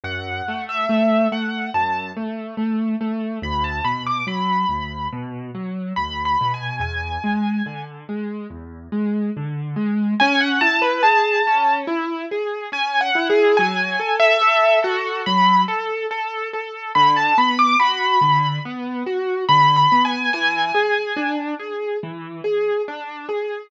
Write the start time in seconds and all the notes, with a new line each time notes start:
0.04 F#2 F#5
0.48 A3
0.69 E5
0.89 A3
1.32 A3 F#5
1.74 F#2 A5
2.16 A3
2.57 A3
3.01 A3
3.42 D2 B5
3.64 A5
3.84 B2 B5
4.07 D6
4.27 F#3 B5
4.69 D2
5.12 B2
5.55 F#3
5.96 D2 B5
6.25 B5
6.41 B2
6.54 G#5
6.79 E2 G#5
7.24 G#3
7.66 D3
8.09 G#3
8.50 E2
8.92 G#3
9.37 D3
9.76 G#3
10.20 C#4 G#5
10.40 F#5
10.61 E4 A5
10.82 B4
11.03 G#4 A5
11.47 C#4
11.87 E4
12.31 G#4
12.72 C#4 G#5
13.01 F#5
13.15 E4
13.30 G#4
13.57 F#3 G#5
13.99 A4
14.20 E5
14.41 A4
14.82 F#4 A4
15.26 F#3 B5
15.68 A4
16.11 A4
16.53 A4
16.95 D3 B5
17.16 A5
17.37 B3 B5
17.59 D6
17.80 F#4 B5
18.21 D3
18.65 B3
19.06 F#4
19.48 D3 B5
19.76 B5
19.92 B3
20.05 G#5
20.33 E3 G#5
20.74 G#4
21.16 D4
21.59 G#4
22.03 E3
22.44 G#4
22.88 D4
23.29 G#4